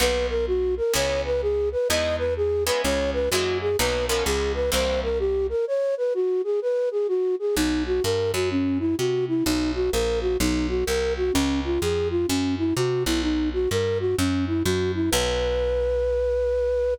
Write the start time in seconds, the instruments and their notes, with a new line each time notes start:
0.00 electric bass (finger) B1, acoustic guitar (steel) A#3 B3 D#4 F#4, flute B4
0.29 flute A#4
0.47 flute F#4
0.77 flute A#4
0.94 electric bass (finger) C#2, acoustic guitar (steel) G#3 B3 C#4 E4, flute C#5
1.25 flute B4
1.42 flute G#4
1.72 flute B4
1.89 electric bass (finger) E2, acoustic guitar (steel) G#3 B3 D#4 E4, flute D#5
2.18 flute B4
2.37 flute G#4
2.66 acoustic guitar (steel) G#3 B3 C#4 E4, flute B4
2.83 electric bass (finger) C#2, flute C#5
3.13 flute B4
3.31 electric bass (finger) F#2, acoustic guitar (steel) F#3 G#3 A#3 E4, flute F#4
3.61 flute G#4
3.78 electric bass (finger) B1, acoustic guitar (steel) F#3 A#3 B3 D#4, flute B4
4.08 acoustic guitar (steel) F3 G#3 B3 C#4, flute A#4
4.25 electric bass (finger) C#2, flute G#4
4.54 flute B4
4.72 electric bass (finger) C2, acoustic guitar (steel) E3 G3 A#3 C4, flute C5
5.03 flute A#4
5.19 flute G4
5.49 flute A#4
5.67 flute C#5
5.97 flute B4
6.14 flute F#4
6.44 flute G#4
6.62 flute B4
6.91 flute G#4
7.08 flute F#4
7.39 flute G#4
7.56 electric bass (finger) B1, flute D#4
7.87 flute F#4
8.04 electric bass (finger) G2, flute A#4
8.33 electric bass (finger) F#2, flute F#4
8.51 flute C#4
8.79 flute E4
8.98 electric bass (finger) C3, flute F#4
9.28 flute E4
9.44 electric bass (finger) B1, flute D#4
9.75 flute F#4
9.92 electric bass (finger) A#1, flute A#4
10.21 flute F#4
10.40 electric bass (finger) B1, flute D#4
10.69 flute F#4
10.86 electric bass (finger) C2, flute A#4
11.17 flute F#4
11.33 electric bass (finger) C#2, flute C#4
11.64 flute F4
11.81 electric bass (finger) F2, flute G#4
12.11 flute F4
12.28 electric bass (finger) F#2, flute C#4
12.58 flute E4
12.76 electric bass (finger) C3, flute F#4
13.06 electric bass (finger) B1, flute E4
13.22 flute D#4
13.53 flute F#4
13.71 electric bass (finger) G2, flute A#4
14.00 flute F#4
14.18 electric bass (finger) F#2, flute C#4
14.47 flute E4
14.64 electric bass (finger) F#2, flute F#4
14.94 flute E4
15.11 electric bass (finger) B1, flute B4